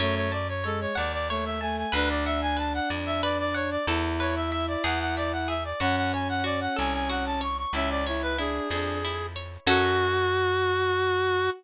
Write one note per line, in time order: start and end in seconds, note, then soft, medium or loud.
0.00 0.87 F#2 loud
0.00 0.27 A3 loud
0.00 0.15 C#5 medium
0.00 0.63 C#5 medium
0.16 0.31 C#5 medium
0.32 0.48 D5 medium
0.32 1.60 A5 medium
0.48 0.64 C#5 medium
0.64 0.92 G#3 loud
0.64 0.80 A4 medium
0.64 1.30 C#5 medium
0.81 0.96 C#5 medium
0.95 1.84 D#2 medium
0.95 1.12 D5 medium
0.95 1.87 F#5 medium
1.13 1.28 D5 medium
1.29 1.59 A3 loud
1.29 1.45 C#5 medium
1.29 1.91 C#5 medium
1.45 1.60 E5 medium
1.60 1.86 A3 loud
1.60 1.76 G#5 medium
1.60 1.92 A5 medium
1.78 1.93 G#5 medium
1.92 2.80 D2 loud
1.92 3.78 D4 loud
1.92 2.56 B4 medium
1.92 2.09 B4 medium
2.10 2.25 D5 medium
2.26 2.41 E5 medium
2.26 3.54 F#5 medium
2.42 2.57 G#5 medium
2.57 3.23 B4 medium
2.57 2.73 A5 medium
2.74 2.89 F#5 medium
2.90 3.77 F2 medium
2.90 3.82 D5 medium
3.06 3.22 E5 medium
3.23 3.84 B4 medium
3.23 3.38 D5 medium
3.39 3.55 D5 medium
3.54 3.70 C#5 medium
3.54 3.85 F#5 medium
3.71 3.86 D5 medium
3.87 4.76 E2 loud
3.87 5.53 E4 loud
3.87 4.80 A4 medium
4.20 4.81 B4 medium
4.20 4.35 C#5 medium
4.36 4.51 E5 medium
4.51 4.66 E5 medium
4.51 4.83 E5 medium
4.68 4.83 D5 medium
4.84 5.73 E2 loud
4.84 5.47 G#4 medium
4.84 4.99 F#5 medium
5.00 5.15 F#5 medium
5.17 5.32 D5 medium
5.17 5.78 E5 medium
5.32 5.48 F#5 medium
5.48 5.79 G#4 medium
5.48 5.64 E5 medium
5.65 5.80 D5 medium
5.80 6.68 F#2 loud
5.80 7.43 C#4 loud
5.80 6.43 F#4 medium
5.80 5.96 F#5 medium
5.97 6.12 F#5 medium
6.12 7.41 C#5 medium
6.12 6.28 G#5 medium
6.29 6.44 F#5 medium
6.44 7.09 F#4 medium
6.44 6.60 D5 medium
6.61 6.76 F#5 medium
6.76 7.66 C2 medium
6.76 7.68 A4 medium
6.76 6.93 G#5 medium
6.93 7.09 G#5 medium
7.10 7.71 F#4 medium
7.10 7.25 F#5 medium
7.26 7.41 A5 medium
7.41 7.72 C#5 medium
7.41 7.57 C#6 medium
7.58 7.73 C#6 medium
7.73 8.60 C#2 loud
7.73 8.02 C#4 loud
7.73 8.38 E4 medium
7.73 7.90 E5 medium
7.90 8.06 D5 medium
8.06 8.34 E4 loud
8.06 9.35 C#5 medium
8.06 8.22 C#5 medium
8.22 8.37 B4 medium
8.37 8.67 D4 loud
8.37 9.04 E4 medium
8.37 9.27 G#4 medium
8.70 9.58 F2 medium
8.70 8.98 D4 loud
8.70 9.63 G#4 medium
9.05 9.66 E4 medium
9.36 9.67 C#5 medium
9.67 11.49 F#2 loud
9.67 11.50 C#4 loud
9.67 11.50 F#4 loud
9.67 11.50 A4 medium